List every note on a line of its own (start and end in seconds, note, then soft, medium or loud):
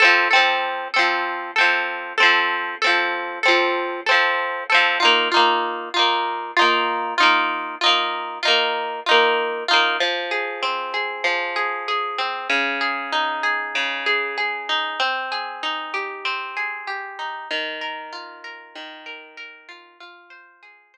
0.00 0.28 C4 medium
0.00 0.28 A4 loud
0.04 0.28 F3 medium
0.31 0.88 C4 medium
0.31 0.88 A4 medium
0.36 0.88 F3 medium
0.94 1.51 C4 medium
0.94 1.51 A4 medium
0.99 1.51 F3 medium
1.56 2.13 C4 medium
1.56 2.13 A4 medium
1.61 2.13 F3 medium
2.18 2.75 C4 medium
2.18 2.75 A4 medium
2.23 2.75 F3 medium
2.82 3.39 C4 medium
2.82 3.39 A4 medium
2.87 3.39 F3 medium
3.43 4.01 C4 medium
3.43 4.01 A4 medium
3.48 4.01 F3 medium
4.06 4.64 C4 medium
4.06 4.64 A4 medium
4.11 4.64 F3 medium
4.70 4.98 C4 medium
4.70 4.98 A4 medium
4.74 4.98 F3 medium
5.00 5.29 D#4 medium
5.00 5.29 F4 medium
5.05 5.29 A#3 medium
5.32 5.89 D#4 medium
5.32 5.89 F4 medium
5.36 5.89 A#3 medium
5.94 6.52 D#4 medium
5.94 6.52 F4 medium
5.99 6.52 A#3 medium
6.57 7.14 D#4 medium
6.57 7.14 F4 medium
6.61 7.14 A#3 medium
7.18 7.75 D#4 medium
7.18 7.75 F4 medium
7.23 7.75 A#3 medium
7.81 8.39 D#4 medium
7.81 8.39 F4 medium
7.86 8.39 A#3 medium
8.43 9.00 D#4 medium
8.43 9.00 F4 medium
8.48 9.00 A#3 medium
9.06 9.64 D#4 medium
9.06 9.64 F4 medium
9.11 9.64 A#3 medium
9.68 9.97 D#4 medium
9.68 9.97 F4 medium
9.73 9.97 A#3 medium
10.00 11.24 F3 medium
10.31 10.93 G#4 medium
10.62 12.18 C4 medium
10.94 11.55 G#4 medium
11.24 12.43 F3 medium
11.56 11.88 G#4 medium
11.88 12.48 G#4 medium
12.18 12.48 C4 medium
12.50 13.75 C#3 medium
12.81 13.43 G#4 medium
13.12 14.69 D#4 medium
13.43 14.06 G#4 medium
13.75 14.94 C#3 medium
14.06 14.37 G#4 medium
14.38 14.97 G#4 medium
14.69 14.99 D#4 medium
15.00 16.24 C4 medium
15.32 16.56 G#4 medium
15.63 17.18 D#4 medium
15.94 16.87 G4 medium
16.25 17.44 C4 medium
16.57 17.46 G#4 medium
16.87 17.47 G4 medium
17.19 17.49 D#4 medium
17.51 18.75 D#3 medium
17.81 18.44 A#4 medium
18.12 19.68 F4 medium
18.44 19.05 A#4 medium
18.75 19.94 D#3 medium
19.06 19.37 A#4 medium
19.37 19.97 A#4 medium
19.69 19.98 F4 medium
20.00 20.97 F4 medium
20.30 20.93 C5 medium
20.63 20.97 G#4 medium
20.94 20.97 C5 medium